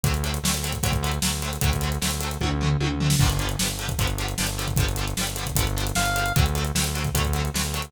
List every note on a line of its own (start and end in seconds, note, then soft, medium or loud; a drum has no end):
0.04 0.39 D2 medium
0.04 0.12 D3 medium
0.04 0.12 F#3 medium
0.04 kick medium
0.04 closed hi-hat medium
0.08 0.12 A3 medium
0.08 0.13 C4 medium
0.14 closed hi-hat medium
0.24 0.31 D3 medium
0.24 0.31 F#3 medium
0.24 0.31 A3 medium
0.24 closed hi-hat medium
0.29 0.32 C4 medium
0.34 closed hi-hat medium
0.43 0.79 D2 medium
0.43 0.52 D3 medium
0.43 0.52 F#3 medium
0.43 snare loud
0.47 0.52 A3 medium
0.47 0.52 C4 medium
0.54 closed hi-hat medium
0.63 0.71 D3 medium
0.63 0.71 F#3 medium
0.63 0.71 A3 medium
0.63 closed hi-hat medium
0.69 0.72 C4 medium
0.69 closed hi-hat medium
0.73 kick medium
0.83 1.19 D2 medium
0.83 0.91 D3 medium
0.83 0.91 F#3 loud
0.83 0.91 A3 loud
0.83 kick medium
0.83 closed hi-hat medium
0.89 0.92 C4 medium
0.89 kick medium
0.93 closed hi-hat medium
1.03 1.11 D3 medium
1.03 1.11 F#3 medium
1.03 1.11 A3 medium
1.03 closed hi-hat medium
1.08 1.11 C4 medium
1.08 closed hi-hat medium
1.22 1.58 D2 medium
1.22 1.30 D3 medium
1.22 1.30 F#3 medium
1.22 snare loud
1.26 1.30 A3 medium
1.26 1.31 C4 medium
1.42 1.50 D3 medium
1.42 1.50 F#3 medium
1.42 1.50 A3 medium
1.42 closed hi-hat medium
1.48 1.51 C4 medium
1.53 closed hi-hat medium
1.61 1.98 D2 medium
1.61 1.70 D3 loud
1.61 1.70 F#3 loud
1.61 kick medium
1.61 closed hi-hat medium
1.66 1.70 A3 medium
1.66 1.70 C4 loud
1.72 kick medium
1.72 closed hi-hat medium
1.81 1.89 D3 medium
1.81 1.89 F#3 medium
1.81 closed hi-hat medium
1.85 1.89 A3 medium
1.85 1.90 C4 medium
1.92 closed hi-hat medium
2.02 2.38 D2 medium
2.02 2.09 D3 medium
2.02 2.09 F#3 medium
2.02 2.09 A3 medium
2.02 snare medium
2.07 2.10 C4 medium
2.07 closed hi-hat medium
2.21 2.29 D3 medium
2.21 2.29 F#3 medium
2.21 closed hi-hat medium
2.25 2.29 A3 medium
2.25 2.30 C4 medium
2.31 closed hi-hat medium
2.41 2.77 D2 medium
2.41 2.49 D3 medium
2.41 2.49 F#3 loud
2.41 kick medium
2.41 high tom medium
2.45 2.49 A3 medium
2.45 2.50 C4 loud
2.61 2.69 D3 medium
2.61 2.69 F#3 medium
2.61 2.69 A3 medium
2.61 floor tom medium
2.66 2.69 C4 medium
2.80 3.16 D2 medium
2.80 2.88 D3 medium
2.80 2.88 F#3 medium
2.80 2.88 A3 medium
2.80 high tom medium
2.86 2.89 C4 medium
3.00 3.08 D3 medium
3.00 3.08 F#3 medium
3.00 3.08 A3 medium
3.00 floor tom medium
3.06 3.09 C4 medium
3.10 snare medium
3.19 3.56 G1 medium
3.19 3.28 D3 loud
3.19 3.28 F3 medium
3.19 kick loud
3.19 crash medium
3.24 3.28 G3 medium
3.24 3.29 B3 loud
3.30 closed hi-hat medium
3.39 3.48 D3 medium
3.39 3.48 F3 medium
3.39 closed hi-hat medium
3.43 3.48 G3 medium
3.43 3.48 B3 medium
3.49 closed hi-hat medium
3.59 3.95 G1 medium
3.59 3.67 D3 medium
3.59 3.67 F3 medium
3.59 3.67 G3 medium
3.59 snare medium
3.65 3.68 B3 medium
3.65 closed hi-hat medium
3.79 3.87 D3 medium
3.79 3.87 F3 medium
3.79 3.87 G3 medium
3.79 closed hi-hat medium
3.85 3.88 B3 medium
3.85 kick medium
3.89 closed hi-hat medium
3.99 4.35 G1 medium
3.99 4.07 D3 medium
3.99 4.07 F3 loud
3.99 4.07 G3 medium
3.99 kick medium
3.99 closed hi-hat medium
4.04 4.07 B3 loud
4.04 closed hi-hat medium
4.18 4.26 D3 medium
4.18 4.26 F3 medium
4.18 4.26 G3 medium
4.18 closed hi-hat medium
4.24 4.27 B3 medium
4.28 closed hi-hat medium
4.38 4.75 G1 medium
4.38 4.46 D3 medium
4.38 4.46 F3 medium
4.38 snare medium
4.42 4.46 G3 medium
4.42 4.47 B3 medium
4.47 closed hi-hat medium
4.58 4.66 D3 medium
4.58 4.66 F3 loud
4.58 4.66 G3 medium
4.58 closed hi-hat medium
4.64 4.67 B3 medium
4.68 kick medium
4.68 closed hi-hat medium
4.76 5.14 G1 medium
4.76 4.86 D3 medium
4.76 4.86 F3 loud
4.76 kick medium
4.76 closed hi-hat medium
4.82 4.86 G3 loud
4.82 4.87 B3 medium
4.89 closed hi-hat medium
4.96 5.05 D3 medium
4.96 5.05 F3 medium
4.96 closed hi-hat medium
5.01 5.05 G3 medium
5.01 5.06 B3 medium
5.08 closed hi-hat medium
5.17 5.53 G1 medium
5.17 5.25 D3 medium
5.17 5.25 F3 medium
5.17 snare medium
5.21 5.25 G3 medium
5.21 5.26 B3 medium
5.27 closed hi-hat medium
5.36 5.45 D3 medium
5.36 5.45 F3 medium
5.36 closed hi-hat medium
5.41 5.45 G3 medium
5.41 5.46 B3 medium
5.46 kick medium
5.46 closed hi-hat medium
5.55 5.92 G1 medium
5.55 5.65 D3 medium
5.55 5.65 F3 loud
5.55 kick medium
5.55 closed hi-hat loud
5.60 5.65 G3 medium
5.60 5.65 B3 medium
5.67 closed hi-hat medium
5.77 5.85 D3 medium
5.77 5.85 F3 medium
5.77 5.85 G3 medium
5.77 closed hi-hat medium
5.82 5.85 B3 medium
5.87 closed hi-hat medium
5.95 6.32 G1 medium
5.95 6.04 D3 medium
5.95 6.04 F3 medium
5.95 6.32 F5 medium
5.95 snare medium
6.00 6.04 G3 medium
6.00 6.05 B3 medium
6.06 closed hi-hat medium
6.16 6.24 D3 medium
6.16 6.24 F3 medium
6.16 6.24 G3 medium
6.16 closed hi-hat medium
6.21 6.24 B3 medium
6.26 closed hi-hat medium
6.36 6.72 D2 medium
6.36 6.44 D3 loud
6.36 6.44 F#3 loud
6.36 6.44 A3 medium
6.36 kick loud
6.36 closed hi-hat medium
6.41 6.44 C4 loud
6.46 closed hi-hat medium
6.55 6.63 D3 medium
6.55 6.63 F#3 medium
6.55 6.63 A3 medium
6.55 closed hi-hat medium
6.61 6.64 C4 medium
6.61 closed hi-hat medium
6.75 7.10 D2 medium
6.75 6.83 D3 medium
6.75 6.83 F#3 medium
6.75 snare loud
6.79 6.83 A3 medium
6.79 6.84 C4 medium
6.84 closed hi-hat medium
6.95 7.03 D3 medium
6.95 7.03 F#3 medium
6.95 7.03 A3 medium
6.95 closed hi-hat medium
7.00 7.03 C4 medium
7.05 kick medium
7.05 closed hi-hat medium
7.14 7.50 D2 medium
7.14 7.23 D3 loud
7.14 7.23 F#3 medium
7.14 7.23 A3 loud
7.14 kick medium
7.14 closed hi-hat medium
7.20 7.23 C4 medium
7.20 kick medium
7.25 closed hi-hat medium
7.33 7.42 D3 medium
7.33 7.42 F#3 medium
7.33 closed hi-hat medium
7.38 7.42 A3 medium
7.38 7.43 C4 medium
7.45 closed hi-hat medium
7.54 7.90 D2 medium
7.54 7.62 D3 medium
7.54 7.62 F#3 medium
7.54 7.62 A3 medium
7.54 snare medium
7.60 7.63 C4 medium
7.64 closed hi-hat medium
7.74 7.82 D3 medium
7.74 7.82 F#3 medium
7.74 7.82 A3 medium
7.74 closed hi-hat medium
7.79 7.82 C4 medium
7.79 closed hi-hat medium